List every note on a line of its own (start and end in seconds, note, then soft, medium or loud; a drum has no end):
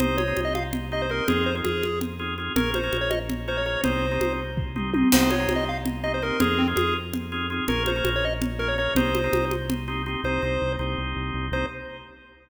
0.00 0.33 C2 loud
0.00 0.22 A#3 loud
0.00 0.22 C4 loud
0.00 0.22 D#4 loud
0.00 0.22 G4 loud
0.00 0.17 C5 loud
0.00 low conga medium
0.18 0.41 C#5 medium
0.18 high conga medium
0.28 0.57 A#3 medium
0.28 0.57 C4 medium
0.28 0.57 D#4 loud
0.28 0.57 G4 medium
0.37 1.21 C2 medium
0.37 high conga medium
0.45 0.54 D#5 medium
0.55 0.64 F5 medium
0.55 high conga medium
0.73 low conga medium
0.92 1.06 A#3 loud
0.92 1.06 C4 medium
0.92 1.06 D#4 loud
0.92 1.06 G4 loud
0.92 1.02 D#5 medium
1.02 1.11 C5 medium
1.09 1.24 A#3 loud
1.09 1.24 C4 medium
1.09 1.24 D#4 medium
1.09 1.24 G4 loud
1.09 1.28 A#4 medium
1.28 1.62 F2 loud
1.28 1.50 C4 loud
1.28 1.50 D#4 loud
1.28 1.50 F4 loud
1.28 1.45 G#4 loud
1.28 1.50 G#4 loud
1.28 low conga medium
1.46 1.55 C5 medium
1.55 1.85 C4 medium
1.55 1.85 D#4 medium
1.55 1.85 F4 medium
1.55 1.85 G#4 medium
1.64 2.50 F2 medium
1.64 1.99 G#4 medium
1.64 high conga medium
1.83 high conga medium
2.01 low conga medium
2.19 2.34 C4 medium
2.19 2.34 D#4 medium
2.19 2.34 F4 medium
2.19 2.34 G#4 medium
2.38 2.53 C4 medium
2.38 2.53 D#4 medium
2.38 2.53 F4 medium
2.38 2.53 G#4 medium
2.56 2.89 A#1 medium
2.56 2.78 A#3 loud
2.56 2.78 C#4 loud
2.56 2.78 F4 loud
2.56 2.78 G#4 loud
2.56 2.71 A#4 loud
2.56 low conga medium
2.74 2.97 C5 medium
2.74 high conga medium
2.84 3.13 A#3 medium
2.84 3.13 C#4 medium
2.84 3.13 F4 medium
2.84 3.13 G#4 loud
2.93 3.77 A#1 medium
2.93 high conga medium
3.01 3.10 C#5 medium
3.11 3.19 D#5 medium
3.11 high conga medium
3.30 low conga medium
3.48 3.62 A#3 loud
3.48 3.62 C#4 medium
3.48 3.62 F4 loud
3.48 3.62 G#4 medium
3.48 3.57 C5 medium
3.57 3.66 C#5 medium
3.66 3.80 A#3 medium
3.66 3.80 C#4 medium
3.66 3.80 F4 medium
3.66 3.80 G#4 medium
3.66 3.81 C#5 medium
3.84 4.18 C2 loud
3.84 4.06 A#3 loud
3.84 4.06 C4 loud
3.84 4.06 D#4 loud
3.84 4.06 G4 loud
3.84 4.33 C5 medium
3.84 low conga medium
4.11 4.41 A#3 medium
4.11 4.41 C4 medium
4.11 4.41 D#4 medium
4.11 4.41 G4 medium
4.20 5.05 C2 medium
4.20 high conga medium
4.57 kick medium
4.76 4.90 A#3 medium
4.76 4.90 C4 medium
4.76 4.90 D#4 medium
4.76 4.90 G4 medium
4.76 mid tom medium
4.94 5.09 A#3 medium
4.94 5.09 C4 medium
4.94 5.09 D#4 medium
4.94 5.09 G4 medium
4.94 high tom medium
5.12 5.47 C2 medium
5.12 5.34 A#3 loud
5.12 5.34 C4 loud
5.12 5.34 D#4 loud
5.12 5.34 G4 loud
5.12 5.31 C5 loud
5.12 crash loud
5.12 low conga loud
5.30 5.53 C#5 loud
5.30 high conga medium
5.40 5.69 A#3 loud
5.40 5.69 C4 medium
5.40 5.69 D#4 medium
5.40 5.69 G4 medium
5.48 6.32 C2 medium
5.48 high conga medium
5.56 5.64 D#5 loud
5.69 5.78 F5 loud
5.86 low conga medium
6.04 6.18 A#3 loud
6.04 6.18 C4 medium
6.04 6.18 D#4 medium
6.04 6.18 G4 medium
6.04 6.12 D#5 loud
6.14 6.23 C5 medium
6.22 6.37 A#3 medium
6.22 6.37 C4 loud
6.22 6.37 D#4 loud
6.22 6.37 G4 loud
6.22 6.40 A#4 loud
6.40 6.74 F2 loud
6.40 6.62 C4 loud
6.40 6.62 D#4 loud
6.40 6.62 F4 loud
6.40 6.62 G#4 loud
6.40 6.58 G#4 loud
6.40 low conga loud
6.58 6.67 C4 loud
6.68 6.97 C4 loud
6.68 6.97 D#4 loud
6.68 6.97 F4 loud
6.68 6.97 G#4 loud
6.76 7.61 F2 medium
6.76 6.94 G#4 loud
6.76 high conga medium
7.13 low conga medium
7.32 7.47 C4 medium
7.32 7.47 D#4 loud
7.32 7.47 F4 loud
7.32 7.47 G#4 loud
7.50 7.65 C4 loud
7.50 7.65 D#4 loud
7.50 7.65 F4 medium
7.50 7.65 G#4 loud
7.68 8.02 A#1 loud
7.68 7.90 A#3 loud
7.68 7.90 C#4 loud
7.68 7.90 F4 loud
7.68 7.90 G#4 loud
7.68 7.83 A#4 loud
7.68 low conga medium
7.86 8.10 C5 loud
7.86 high conga medium
7.96 8.25 A#3 loud
7.96 8.25 C#4 medium
7.96 8.25 F4 loud
7.96 8.25 G#4 medium
8.04 8.88 A#1 loud
8.04 high conga medium
8.16 8.25 C#5 loud
8.25 8.34 D#5 loud
8.42 low conga medium
8.59 8.74 A#3 medium
8.59 8.74 C#4 loud
8.59 8.74 F4 medium
8.59 8.74 G#4 loud
8.59 8.68 A#4 loud
8.68 8.77 C#5 loud
8.78 8.93 A#3 loud
8.78 8.93 C#4 loud
8.78 8.93 F4 loud
8.78 8.93 G#4 loud
8.78 8.94 C#5 loud
8.95 9.29 C2 loud
8.95 9.18 A#3 loud
8.95 9.18 C4 loud
8.95 9.18 D#4 loud
8.95 9.18 G4 loud
8.95 9.45 C5 loud
8.95 low conga loud
9.15 high conga medium
9.24 9.53 A#3 loud
9.24 9.53 C4 medium
9.24 9.53 D#4 loud
9.24 9.53 G4 medium
9.33 10.17 C2 medium
9.33 high conga medium
9.51 high conga medium
9.70 low conga medium
9.88 10.02 A#3 medium
9.88 10.02 C4 loud
9.88 10.02 D#4 loud
9.88 10.02 G4 loud
10.06 10.21 A#3 loud
10.06 10.21 C4 loud
10.06 10.21 D#4 medium
10.06 10.21 G4 loud
10.24 10.39 C2 loud
10.24 10.41 A#3 loud
10.24 10.41 C4 loud
10.24 10.41 D#4 loud
10.24 10.41 G4 loud
10.24 10.73 C5 loud
10.42 10.58 C2 loud
10.42 10.76 A#3 medium
10.42 10.76 C4 medium
10.42 10.76 D#4 medium
10.42 10.76 G4 medium
10.62 10.77 C2 medium
10.79 10.95 C2 loud
10.79 11.46 A#3 medium
10.79 11.46 C4 medium
10.79 11.46 D#4 medium
10.79 11.46 G4 medium
10.98 11.14 C2 medium
11.16 11.32 C2 medium
11.34 11.50 C2 loud
11.52 11.65 C2 loud
11.52 11.66 A#3 loud
11.52 11.66 C4 loud
11.52 11.66 D#4 loud
11.52 11.66 G4 medium
11.52 11.66 C5 loud